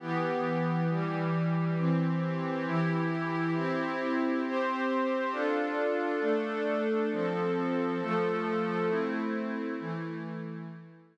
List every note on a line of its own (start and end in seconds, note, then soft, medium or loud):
0.00 0.87 E3 medium
0.00 0.87 B3 medium
0.00 0.87 G4 medium
0.90 1.77 E3 medium
0.90 1.78 G3 medium
0.90 1.77 G4 medium
1.78 2.66 E3 medium
1.78 2.66 C4 medium
1.78 2.66 G4 medium
2.66 3.54 E3 medium
2.66 3.54 E4 medium
2.66 3.54 G4 medium
3.54 4.42 C4 medium
3.54 4.42 E4 medium
3.54 4.42 G4 medium
4.45 5.33 C4 medium
4.45 5.33 G4 medium
4.45 5.33 C5 medium
5.32 6.20 D4 medium
5.32 6.20 F4 medium
5.32 6.20 A4 medium
6.20 7.08 A3 medium
6.20 7.08 D4 medium
6.20 7.08 A4 medium
7.11 7.99 F3 medium
7.11 7.99 C4 medium
7.11 7.99 A4 medium
8.01 8.89 F3 medium
8.01 8.87 A3 medium
8.01 8.89 A4 medium
8.87 9.75 A3 medium
8.87 9.75 C4 medium
8.87 9.75 E4 medium
9.79 10.67 E3 medium
9.79 10.67 A3 medium
9.79 10.67 E4 medium